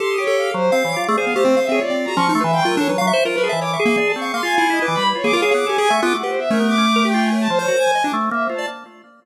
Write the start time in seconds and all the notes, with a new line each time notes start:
0.00 G4 A4 C6
0.10 D#6
0.18 G4 C#5
0.27 A4
0.37 F5
0.54 F#3 C5
0.72 C4 F5
0.83 E3 C#5
0.92 D6
0.96 F4
1.01 D6
1.08 A3 G#4 D5
1.17 G#4 C5 F5
1.27 B3
1.35 A3 G4 C5
1.45 C4
1.57 F5
1.63 E5
1.69 C4 G#4 C#5
1.81 F4 D5
1.90 C4 D5
2.05 F#4 A#5
2.16 F3 C#4 C#6
2.29 D#4
2.34 A3 C6
2.41 E3 B4 E5
2.53 F5 G5
2.62 F#3 F4 A#4
2.77 D4 A4 C#5
2.89 F#3 B4 C#5
2.98 F#3 F5
3.07 E5 C#6
3.13 C5
3.25 F4 A#4 C5
3.34 A#4 B4
3.43 G#4 A5
3.49 E3 D#5 E5
3.61 C#5 D6
3.70 E5 C#6
3.79 G#4 E5
3.85 A#3
3.97 D5
4.05 A5
4.10 D5
4.15 C4 C#6
4.22 F5
4.34 A#3 F5 C6
4.43 F4 G#5
4.58 E4
4.70 E4 D#5
4.82 B4 D6
4.88 E3
4.94 G3 B5
5.07 B4
5.15 F4 C#5
5.24 A#3 G#4 D6
5.33 F4 A#4 F5
5.42 G#4 C#5 F5
5.51 B3 G#4 D6
5.66 G4 A4 G#5
5.78 G4 G#4 G#5
5.89 A3 E5 C#6
6.02 B3 F4 D6
6.14 A3 F#5
6.23 G4 B4 C5
6.39 E5
6.50 A3 C#4 A#4
6.60 B3
6.68 D6
6.78 C#4
6.96 A#4
7.05 G4 G5
7.14 F4
7.22 G#5
7.32 C#5
7.41 A5
7.50 F3 C5
7.59 C5 C#5
7.68 F#4 A#4
7.78 G#5
7.95 D#5
8.04 D4 D6
8.13 A3
8.31 A#3 E5
8.44 C5
8.49 F4
8.54 A5
8.58 D5